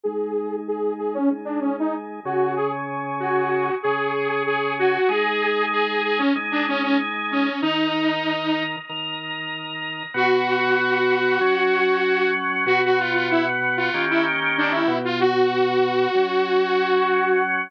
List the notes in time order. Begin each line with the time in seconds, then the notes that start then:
0.03 G#3 D#4 G#4
0.68 G#4
0.98 G#4
1.14 C#4
1.30 G#3 D#4 G#4
1.45 D4
1.61 C#4
1.80 D#4
2.25 C#3 C#4 F#4 G#4
2.56 G#4
3.20 F#4
3.83 C#3 C#4 G#4
4.46 G#4
4.79 F#4
5.09 G#3 D#4 G#4
5.72 G#4
6.04 G#4
6.18 C#4
6.35 G#3 D#4 G#4
6.51 D4
6.68 C#4
6.83 C#4
7.31 C#4
7.62 D#3 D#4 A#4
8.89 D#3 D#4 A#4
10.14 B2 B3 F#4
11.41 F#3 C#4 F#4
12.66 B2 B3 F#4
12.85 F#4
12.99 F4
13.14 F4
13.31 E4
13.77 F4
13.94 D#3 A#3 C#4 G4
14.10 E4
14.58 D4
14.71 E4
14.88 B2 B3 F#4
15.05 F4
15.20 F#4
16.15 F#3 C#4 F#4